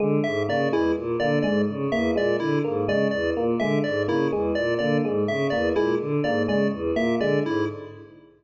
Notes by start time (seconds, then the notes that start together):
0.00 D3 G#3
0.24 G#2 E5
0.48 C#3 A#3 D5
0.72 E2 G#3 E4
0.96 A#2
1.20 D3 A#3 D5
1.43 G#2 G#3 D5
1.68 C#3
1.92 E2 A#3 E5
2.16 A#2 G#3 D5
2.40 D3 E4
2.64 G#2 A#3
2.88 C#3 G#3 D5
3.11 E2 D5
3.36 A#2 A#3
3.60 D3 G#3 E5
3.84 G#2 D5
4.08 C#3 A#3 E4
4.32 E2 G#3
4.55 A#2 D5
4.79 D3 A#3 D5
5.04 G#2 G#3
5.28 C#3 E5
5.50 E2 A#3 D5
5.76 A#2 G#3 E4
6.00 D3
6.24 G#2 A#3 D5
6.48 C#3 G#3 D5
6.72 E2
6.96 A#2 A#3 E5
7.20 D3 G#3 D5
7.44 G#2 E4